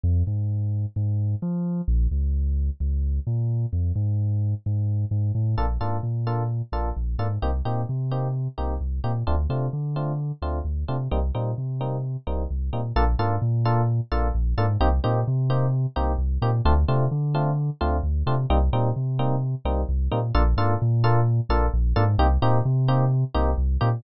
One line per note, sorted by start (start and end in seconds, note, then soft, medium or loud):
0.03 0.23 F2 medium
0.27 0.86 G#2 medium
0.96 1.35 G#2 medium
1.42 1.81 F3 medium
1.88 2.07 A#1 loud
2.11 2.70 C#2 medium
2.80 3.20 C#2 medium
3.27 3.66 A#2 medium
3.73 3.92 F2 medium
3.95 4.54 G#2 medium
4.66 5.05 G#2 medium
5.11 5.32 G#2 medium
5.35 5.55 A2 medium
5.58 5.78 A#1 medium
5.58 5.66 A#3 medium
5.58 5.66 D4 loud
5.58 5.66 F4 medium
5.58 5.66 A4 loud
5.81 6.00 G#2 medium
5.81 5.97 A#3 medium
5.81 5.97 D4 medium
5.81 5.97 F4 medium
5.81 5.97 A4 medium
6.03 6.62 A#2 medium
6.27 6.43 A#3 medium
6.27 6.43 D4 medium
6.27 6.43 F4 medium
6.27 6.43 A4 medium
6.72 6.92 A#1 medium
6.72 6.89 A#3 medium
6.72 6.89 D4 medium
6.72 6.89 F4 medium
6.72 6.89 A4 medium
6.96 7.16 A#1 medium
7.18 7.38 G#2 medium
7.18 7.27 A#3 medium
7.18 7.27 D4 medium
7.18 7.27 F4 medium
7.18 7.27 A4 medium
7.42 7.62 C2 medium
7.42 7.50 A#3 loud
7.42 7.50 C4 medium
7.42 7.50 D#4 loud
7.42 7.50 G4 medium
7.65 7.85 A#2 medium
7.65 7.81 A#3 medium
7.65 7.81 C4 medium
7.65 7.81 D#4 medium
7.65 7.81 G4 medium
7.89 8.48 C3 medium
8.11 8.28 A#3 medium
8.11 8.28 C4 medium
8.11 8.28 D#4 medium
8.11 8.28 G4 medium
8.58 8.78 C2 medium
8.58 8.74 A#3 medium
8.58 8.74 C4 medium
8.58 8.74 D#4 medium
8.58 8.74 G4 medium
8.81 9.00 C2 medium
9.04 9.23 A#2 medium
9.04 9.12 A#3 medium
9.04 9.12 C4 medium
9.04 9.12 D#4 medium
9.04 9.12 G4 medium
9.27 9.47 D2 medium
9.27 9.35 A3 loud
9.27 9.35 C4 loud
9.27 9.35 D4 loud
9.27 9.35 F4 loud
9.49 9.69 C3 medium
9.49 9.66 A3 medium
9.49 9.66 C4 medium
9.49 9.66 D4 medium
9.49 9.66 F4 medium
9.73 10.32 D3 medium
9.96 10.12 A3 medium
9.96 10.12 C4 medium
9.96 10.12 D4 medium
9.96 10.12 F4 medium
10.42 10.61 D2 medium
10.42 10.59 A3 medium
10.42 10.59 C4 medium
10.42 10.59 D4 medium
10.42 10.59 F4 medium
10.65 10.84 D2 medium
10.88 11.08 C3 medium
10.88 10.96 A3 medium
10.88 10.96 C4 medium
10.88 10.96 D4 medium
10.88 10.96 F4 medium
11.11 11.31 C2 medium
11.11 11.19 G3 loud
11.11 11.19 A#3 loud
11.11 11.19 C4 loud
11.11 11.19 D#4 loud
11.35 11.54 A#2 medium
11.35 11.51 G3 medium
11.35 11.51 A#3 medium
11.35 11.51 C4 medium
11.35 11.51 D#4 medium
11.58 12.17 C3 medium
11.81 11.97 G3 medium
11.81 11.97 A#3 medium
11.81 11.97 C4 medium
11.81 11.97 D#4 medium
12.27 12.47 C2 medium
12.27 12.43 G3 medium
12.27 12.43 A#3 medium
12.27 12.43 C4 medium
12.27 12.43 D#4 medium
12.50 12.70 C2 medium
12.73 12.92 A#2 medium
12.73 12.81 G3 medium
12.73 12.81 A#3 loud
12.73 12.81 C4 medium
12.73 12.81 D#4 medium
12.96 13.15 A#1 medium
12.96 13.04 A#3 loud
12.96 13.04 D4 loud
12.96 13.04 F4 loud
12.96 13.04 A4 loud
13.19 13.38 G#2 medium
13.19 13.35 A#3 loud
13.19 13.35 D4 loud
13.19 13.35 F4 loud
13.19 13.35 A4 loud
13.42 14.00 A#2 medium
13.65 13.82 A#3 loud
13.65 13.82 D4 loud
13.65 13.82 F4 loud
13.65 13.82 A4 loud
14.12 14.31 A#1 medium
14.12 14.28 A#3 loud
14.12 14.28 D4 loud
14.12 14.28 F4 loud
14.12 14.28 A4 loud
14.35 14.54 A#1 medium
14.57 14.77 G#2 medium
14.57 14.66 A#3 loud
14.57 14.66 D4 loud
14.57 14.66 F4 loud
14.57 14.66 A4 loud
14.80 15.00 C2 medium
14.80 14.89 A#3 loud
14.80 14.89 C4 loud
14.80 14.89 D#4 loud
14.80 14.89 G4 loud
15.04 15.24 A#2 medium
15.04 15.20 A#3 loud
15.04 15.20 C4 loud
15.04 15.20 D#4 loud
15.04 15.20 G4 loud
15.27 15.86 C3 medium
15.50 15.66 A#3 loud
15.50 15.66 C4 loud
15.50 15.66 D#4 loud
15.50 15.66 G4 loud
15.96 16.16 C2 medium
15.96 16.12 A#3 loud
15.96 16.12 C4 loud
15.96 16.12 D#4 loud
15.96 16.12 G4 loud
16.18 16.38 C2 medium
16.42 16.61 A#2 medium
16.42 16.50 A#3 loud
16.42 16.50 C4 loud
16.42 16.50 D#4 medium
16.42 16.50 G4 loud
16.65 16.85 D2 loud
16.65 16.74 A3 loud
16.65 16.74 C4 loud
16.65 16.74 D4 loud
16.65 16.74 F4 loud
16.88 17.08 C3 medium
16.88 17.05 A3 loud
16.88 17.05 C4 loud
16.88 17.05 D4 loud
16.88 17.05 F4 loud
17.11 17.70 D3 medium
17.35 17.51 A3 loud
17.35 17.51 C4 loud
17.35 17.51 D4 loud
17.35 17.51 F4 loud
17.81 18.01 D2 medium
17.81 17.97 A3 loud
17.81 17.97 C4 loud
17.81 17.97 D4 loud
17.81 17.97 F4 loud
18.03 18.23 D2 medium
18.26 18.46 C3 medium
18.26 18.35 A3 loud
18.26 18.35 C4 loud
18.26 18.35 D4 loud
18.26 18.35 F4 loud
18.50 18.69 C2 medium
18.50 18.58 G3 loud
18.50 18.58 A#3 loud
18.50 18.58 C4 loud
18.50 18.58 D#4 loud
18.73 18.92 A#2 medium
18.73 18.89 G3 loud
18.73 18.89 A#3 medium
18.73 18.89 C4 loud
18.73 18.89 D#4 loud
18.96 19.55 C3 medium
19.19 19.35 G3 loud
19.19 19.35 A#3 loud
19.19 19.35 C4 loud
19.19 19.35 D#4 loud
19.65 19.84 C2 medium
19.65 19.82 G3 loud
19.65 19.82 A#3 loud
19.65 19.82 C4 loud
19.65 19.82 D#4 loud
19.89 20.08 C2 medium
20.11 20.32 A#2 medium
20.11 20.20 G3 loud
20.11 20.20 A#3 loud
20.11 20.20 C4 loud
20.11 20.20 D#4 loud
20.35 20.54 A#1 loud
20.35 20.43 A#3 loud
20.35 20.43 D4 loud
20.35 20.43 F4 loud
20.35 20.43 A4 loud
20.57 20.76 G#2 medium
20.57 20.74 A#3 loud
20.57 20.74 D4 loud
20.57 20.74 F4 loud
20.57 20.74 A4 loud
20.82 21.40 A#2 medium
21.04 21.20 A#3 loud
21.04 21.20 D4 loud
21.04 21.20 F4 loud
21.04 21.20 A4 loud
21.49 21.69 A#1 medium
21.49 21.66 A#3 loud
21.49 21.66 D4 loud
21.49 21.66 F4 loud
21.49 21.66 A4 loud
21.74 21.93 A#1 medium
21.96 22.16 G#2 medium
21.96 22.04 A#3 loud
21.96 22.04 D4 loud
21.96 22.04 F4 loud
21.96 22.04 A4 loud
22.18 22.38 C2 loud
22.18 22.27 A#3 loud
22.18 22.27 C4 loud
22.18 22.27 D#4 loud
22.18 22.27 G4 loud
22.42 22.61 A#2 medium
22.42 22.58 A#3 loud
22.42 22.58 C4 loud
22.42 22.58 D#4 loud
22.42 22.58 G4 loud
22.65 23.24 C3 medium
22.88 23.04 A#3 loud
22.88 23.04 C4 loud
22.88 23.04 D#4 loud
22.88 23.04 G4 loud
23.34 23.55 C2 medium
23.34 23.51 A#3 loud
23.34 23.51 C4 loud
23.34 23.51 D#4 loud
23.34 23.51 G4 loud
23.58 23.77 C2 medium
23.81 24.01 A#2 medium
23.81 23.89 A#3 loud
23.81 23.89 C4 loud
23.81 23.89 D#4 loud
23.81 23.89 G4 loud